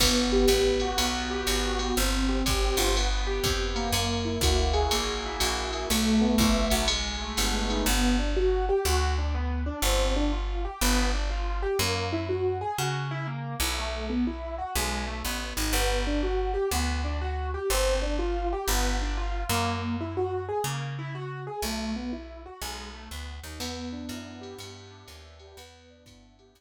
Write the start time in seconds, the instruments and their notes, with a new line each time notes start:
0.00 electric bass (finger) G1, acoustic grand piano B3, kick, crash, ride
0.32 acoustic grand piano G4
0.48 electric bass (finger) A1, acoustic grand piano B3, hi-hat pedal, ride
0.80 acoustic grand piano F#4, ride
0.97 electric bass (finger) B1, acoustic grand piano B3, ride
1.30 acoustic grand piano G4
1.47 electric bass (finger) G#1, acoustic grand piano F#4, hi-hat pedal, ride
1.79 acoustic grand piano B3, ride
1.97 electric bass (finger) G1, acoustic grand piano C4
2.29 acoustic grand piano G4
2.45 electric bass (finger) G#1, acoustic grand piano C4, kick, hi-hat pedal, ride
2.77 electric bass (finger) G1, acoustic grand piano F4, ride
2.96 acoustic grand piano B3, ride
3.27 acoustic grand piano G4
3.44 electric bass (finger) F2, acoustic grand piano B3, kick, hi-hat pedal, ride
3.76 acoustic grand piano A#3, ride
3.92 electric bass (finger) F#2, ride
4.25 acoustic grand piano E4
4.41 electric bass (finger) D2, acoustic grand piano F#4, kick, hi-hat pedal, ride
4.73 acoustic grand piano G#4, ride
4.91 electric bass (finger) A#1, acoustic grand piano A#3, ride
5.25 acoustic grand piano E4
5.40 electric bass (finger) A#1, acoustic grand piano F#4, hi-hat pedal, ride
5.73 acoustic grand piano G#4, ride
5.90 electric bass (finger) B1, acoustic grand piano A3, ride
6.21 acoustic grand piano B3
6.38 electric bass (finger) A#1, acoustic grand piano E4, kick, hi-hat pedal, ride
6.70 electric bass (finger) B1, acoustic grand piano F#4, ride
6.88 acoustic grand piano G#3, ride
7.21 acoustic grand piano A3
7.37 electric bass (finger) G1, acoustic grand piano B3, hi-hat pedal, ride
7.69 acoustic grand piano D#4, ride
7.86 electric bass (finger) G1, acoustic grand piano B3
8.19 acoustic grand piano D4
8.36 acoustic grand piano F#4
8.69 acoustic grand piano G4
8.85 electric bass (finger) D2, acoustic grand piano F#4
9.18 acoustic grand piano D4
9.35 acoustic grand piano B3
9.66 acoustic grand piano D4
9.82 electric bass (finger) G1, acoustic grand piano C4
10.16 acoustic grand piano D4
10.33 acoustic grand piano F4
10.65 acoustic grand piano G4
10.81 electric bass (finger) G1, acoustic grand piano B3
11.14 acoustic grand piano D4
11.30 acoustic grand piano F4
11.62 acoustic grand piano G4
11.79 electric bass (finger) F#2, acoustic grand piano A#3
12.13 acoustic grand piano E4
12.29 acoustic grand piano F#4
12.61 acoustic grand piano G#4
12.78 electric bass (finger) C#3, acoustic grand piano F#4
13.11 acoustic grand piano E4
13.27 acoustic grand piano A#3
13.60 electric bass (finger) B1, acoustic grand piano E4
13.78 acoustic grand piano A3
14.10 acoustic grand piano B3
14.27 acoustic grand piano E4
14.58 acoustic grand piano F#4
14.75 electric bass (finger) B1, acoustic grand piano G#3
15.07 acoustic grand piano A3
15.25 electric bass (finger) A1, acoustic grand piano B3
15.57 electric bass (finger) G#1, acoustic grand piano D#4
15.73 electric bass (finger) G1, acoustic grand piano B3
16.07 acoustic grand piano D4
16.23 acoustic grand piano F#4
16.54 acoustic grand piano G4
16.71 electric bass (finger) D2, acoustic grand piano B3
17.04 acoustic grand piano D4
17.21 acoustic grand piano F#4
17.54 acoustic grand piano G4
17.70 electric bass (finger) G1, acoustic grand piano C4
18.02 acoustic grand piano D4
18.19 acoustic grand piano F4
18.53 acoustic grand piano G4
18.68 electric bass (finger) G1, acoustic grand piano B3
19.02 acoustic grand piano D4
19.17 acoustic grand piano F4
19.49 electric bass (finger) F#2, acoustic grand piano A#3
20.01 acoustic grand piano E4
20.17 acoustic grand piano F#4
20.49 acoustic grand piano G#4
20.64 electric bass (finger) C#3, acoustic grand piano A#3
20.99 acoustic grand piano E4
21.15 acoustic grand piano F#4
21.47 acoustic grand piano G#4
21.62 electric bass (finger) B1, acoustic grand piano A3
21.96 acoustic grand piano B3
22.13 acoustic grand piano E4
22.46 acoustic grand piano F#4
22.61 electric bass (finger) B1, acoustic grand piano G#3
22.94 acoustic grand piano A3
23.11 electric bass (finger) D2, acoustic grand piano B3
23.43 electric bass (finger) D#2, acoustic grand piano D#4
23.60 electric bass (finger) E2, acoustic grand piano B3, crash, ride
23.92 acoustic grand piano D4
24.09 electric bass (finger) F#2, acoustic grand piano E4, hi-hat pedal, ride
24.41 acoustic grand piano G4, ride
24.59 electric bass (finger) G2, acoustic grand piano B3, ride
24.91 acoustic grand piano D4
25.08 electric bass (finger) D#2, acoustic grand piano E4, hi-hat pedal, ride
25.39 acoustic grand piano G4, ride
25.57 electric bass (finger) E2, acoustic grand piano B3, ride
25.90 acoustic grand piano D4
26.06 electric bass (finger) G2, acoustic grand piano E4, kick, hi-hat pedal, ride
26.39 acoustic grand piano G4, ride
26.55 electric bass (finger) E2, acoustic grand piano B3, ride